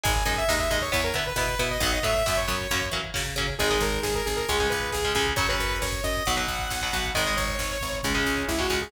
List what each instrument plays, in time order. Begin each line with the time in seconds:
0.04 electric bass (finger) G#1, overdriven guitar G#3 D#4, lead 2 (sawtooth) G#5, kick, closed hi-hat
0.16 kick
0.25 electric bass (finger) F#2, overdriven guitar G#3 D#4, lead 2 (sawtooth) G#5, kick, closed hi-hat
0.36 lead 2 (sawtooth) E5, kick
0.48 electric bass (finger) D#2, overdriven guitar G#3 D#4, lead 2 (sawtooth) D#5, kick, snare
0.58 lead 2 (sawtooth) E5, kick
0.70 electric bass (finger) D#2, overdriven guitar G#3 D#4, lead 2 (sawtooth) D#5, kick, closed hi-hat
0.82 lead 2 (sawtooth) C#5, kick
0.92 electric bass (finger) E2, overdriven guitar B3 E4, lead 2 (sawtooth) C#5, kick, closed hi-hat
1.04 lead 2 (sawtooth) A#4, kick
1.14 electric bass (finger) D3, overdriven guitar B3 E4, lead 2 (sawtooth) B4, kick, closed hi-hat
1.26 lead 2 (sawtooth) B4, kick
1.36 electric bass (finger) B2, overdriven guitar B3 E4, lead 2 (sawtooth) B4, kick, snare
1.48 kick
1.59 electric bass (finger) B2, overdriven guitar B3 E4, lead 2 (sawtooth) B4, kick, closed hi-hat
1.71 lead 2 (sawtooth) D#5, kick
1.80 electric bass (finger) B1, overdriven guitar F#3 B3, lead 2 (sawtooth) F#5, kick, closed hi-hat
1.92 lead 2 (sawtooth) D#5, kick
2.03 electric bass (finger) A2, overdriven guitar F#3 B3, lead 2 (sawtooth) E5, kick, closed hi-hat
2.15 lead 2 (sawtooth) E5, kick
2.26 electric bass (finger) F#2, overdriven guitar F#3 B3, lead 2 (sawtooth) E5, kick, snare
2.37 lead 2 (sawtooth) C#5, kick
2.48 electric bass (finger) F#2, overdriven guitar F#3 B3, kick, closed hi-hat
2.60 kick
2.71 electric bass (finger) F#2, overdriven guitar F#3 A#3 C#4, kick, closed hi-hat
2.82 kick
2.91 electric bass (finger) E3, overdriven guitar F#3 A#3 C#4, kick, closed hi-hat
3.04 kick
3.14 electric bass (finger) C#3, overdriven guitar F#3 A#3 C#4, kick, snare
3.26 kick
3.36 electric bass (finger) C#3, overdriven guitar F#3 A#3 C#4, kick, closed hi-hat
3.47 kick
3.59 electric bass (finger) G#1, overdriven guitar D#3 G#3, lead 2 (sawtooth) G#4, kick, closed hi-hat
3.71 overdriven guitar D#3 G#3, kick
3.80 electric bass (finger) G#1, lead 2 (sawtooth) A#4, kick, closed hi-hat
3.92 kick
4.03 electric bass (finger) G#1, lead 2 (sawtooth) G#4, kick, snare
4.14 lead 2 (sawtooth) A#4, kick
4.26 electric bass (finger) G#1, lead 2 (sawtooth) G#4, kick, closed hi-hat
4.37 lead 2 (sawtooth) A#4, kick
4.49 electric bass (finger) C#2, overdriven guitar C#3 G#3, lead 2 (sawtooth) G#4, kick, closed hi-hat
4.60 overdriven guitar C#3 G#3, kick
4.70 electric bass (finger) C#2, lead 2 (sawtooth) B4, kick, closed hi-hat
4.80 kick
4.91 electric bass (finger) C#2, lead 2 (sawtooth) G#4, kick, snare
5.03 overdriven guitar C#3 G#3, kick
5.15 electric bass (finger) C#2, overdriven guitar C#3 G#3, lead 2 (sawtooth) G#4, kick, closed hi-hat
5.27 kick
5.36 electric bass (finger) F#2, overdriven guitar C#3 F#3, lead 2 (sawtooth) C#5, kick, closed hi-hat
5.49 overdriven guitar C#3 F#3, lead 2 (sawtooth) B4, kick
5.59 electric bass (finger) F#2, kick, closed hi-hat
5.71 kick
5.82 electric bass (finger) F#2, lead 2 (sawtooth) C#5, kick, snare
5.92 kick
6.03 electric bass (finger) F#2, lead 2 (sawtooth) D#5, kick, closed hi-hat
6.16 kick
6.25 electric bass (finger) B1, overdriven guitar B2 F#3, lead 2 (sawtooth) F#5, kick, closed hi-hat
6.37 overdriven guitar B2 F#3, kick
6.48 electric bass (finger) B1, kick, closed hi-hat
6.59 kick
6.70 electric bass (finger) B1, kick, snare
6.81 overdriven guitar B2 F#3, kick
6.92 electric bass (finger) B1, overdriven guitar B2 F#3, kick, closed hi-hat
7.05 kick
7.14 electric bass (finger) G#1, overdriven guitar D#3 G#3, lead 2 (sawtooth) D#5, kick, closed hi-hat
7.26 overdriven guitar D#3 G#3, kick
7.37 electric bass (finger) G#1, lead 2 (sawtooth) C#5, kick, closed hi-hat
7.48 kick
7.59 electric bass (finger) G#1, kick, snare
7.70 kick
7.80 electric bass (finger) G#1, kick, closed hi-hat
7.93 kick
8.03 electric bass (finger) C#2, overdriven guitar C#3 G#3, lead 2 (sawtooth) C#4, kick, closed hi-hat
8.15 overdriven guitar C#3 G#3, kick
8.25 electric bass (finger) C#2, kick, closed hi-hat
8.37 kick
8.48 electric bass (finger) C#2, lead 2 (sawtooth) E4, kick, snare
8.58 overdriven guitar C#3 G#3, lead 2 (sawtooth) F#4, kick
8.70 electric bass (finger) C#2, overdriven guitar C#3 G#3, kick, open hi-hat
8.81 lead 2 (sawtooth) G#4, kick